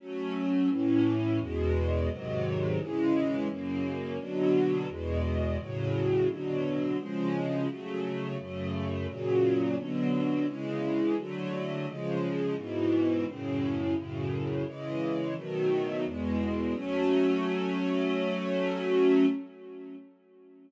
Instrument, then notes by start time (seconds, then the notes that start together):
string ensemble 1
0.00 F#3 A3 C#4
0.70 A2 E3 C#4
1.40 E2 B2 G#3
2.09 G#2 C3 D#3 F#3
2.79 C#3 E3 G#3
3.49 F#2 C#3 A#3
4.18 B2 D3 F#3
4.89 E2 B2 G#3
5.58 A2 C#3 F#3
6.28 B2 D3 F#3
6.98 C#3 F3 G#3
7.68 C#3 F#3 A3
8.38 F#2 C#3 A3
9.07 A#2 C#3 F#3
9.77 B2 D3 F#3
10.46 C#3 E3 G#3
11.17 D3 F#3 A3
11.86 C#3 F3 G#3
12.56 G#2 B2 E3
13.26 F#2 A2 C#3
13.95 F#2 A2 C#3
14.65 C#3 E3 G#3
15.36 B2 D#3 F#3 A3
16.05 E2 B2 G#3
16.74 F#3 A3 C#4